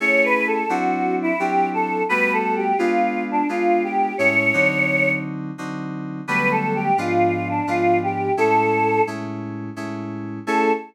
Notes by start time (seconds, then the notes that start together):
0.00 A3 C#4 E4 G#4 C#5
0.24 B4
0.47 A4
0.69 F#3 C4 D4 E4 F#4
1.22 E4
1.39 F#3 C4 D4 E4 G4
1.74 A4
2.09 G3 A3 B3 F#4 B4
2.33 A4
2.56 G4
2.78 G#3 B3 D4 F4
3.31 D4
3.49 G#3 B3 D4 F4
3.83 G4
4.18 A2 G#3 C#4 E4 C#5
4.53 D3 F#3 C4 D#4
5.58 D3 F#3 C4 D#4
6.27 D3 F#3 G3 A3 B3 B4
6.51 A4
6.75 G4
6.98 G#2 F3 B3 D4 F4
7.49 D4
7.67 G#2 F3 B3 D4 F4
8.03 G4
8.37 A2 G#3 C#4 E4 A4
9.07 A2 G#3 C#4 E4
9.76 A2 G#3 C#4 E4
10.47 A3 C#4 E4 G#4 A4